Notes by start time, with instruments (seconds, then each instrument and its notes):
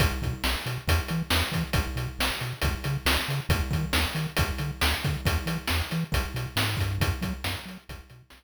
0.00 synth bass 1 B1, kick, closed hi-hat
0.22 synth bass 1 B2, kick, closed hi-hat
0.44 synth bass 1 B1, snare
0.66 synth bass 1 B2, closed hi-hat
0.88 synth bass 1 E2, kick, closed hi-hat
1.08 synth bass 1 E3, closed hi-hat
1.30 synth bass 1 E2, snare
1.52 synth bass 1 E3, kick, closed hi-hat
1.73 synth bass 1 B1, kick, closed hi-hat
1.96 synth bass 1 B2, closed hi-hat
2.19 synth bass 1 B1, snare
2.41 synth bass 1 B2, closed hi-hat
2.61 synth bass 1 C#2, kick, closed hi-hat
2.84 synth bass 1 C#3, closed hi-hat
3.06 synth bass 1 C#2, snare
3.28 synth bass 1 C#3, closed hi-hat
3.49 synth bass 1 D#2, kick, closed hi-hat
3.71 synth bass 1 D#3, kick, closed hi-hat
3.93 synth bass 1 D#2, snare
4.15 synth bass 1 D#3, closed hi-hat
4.37 synth bass 1 D2, kick, closed hi-hat
4.58 synth bass 1 D3, closed hi-hat
4.81 synth bass 1 D2, snare
5.04 synth bass 1 D3, kick, closed hi-hat
5.26 synth bass 1 E2, kick, closed hi-hat
5.46 synth bass 1 E3, closed hi-hat
5.68 synth bass 1 E2, snare
5.91 synth bass 1 E3, closed hi-hat
6.12 synth bass 1 B1, kick, closed hi-hat
6.34 synth bass 1 B2, closed hi-hat
6.56 synth bass 1 G#2, snare
6.77 synth bass 1 G2, kick, closed hi-hat
7.00 synth bass 1 F#2, kick, closed hi-hat
7.22 synth bass 1 F#3, kick, closed hi-hat
7.44 synth bass 1 F#2, snare
7.66 synth bass 1 F#3, closed hi-hat
7.89 synth bass 1 B1, kick, closed hi-hat
8.10 synth bass 1 B2, closed hi-hat
8.30 synth bass 1 B1, snare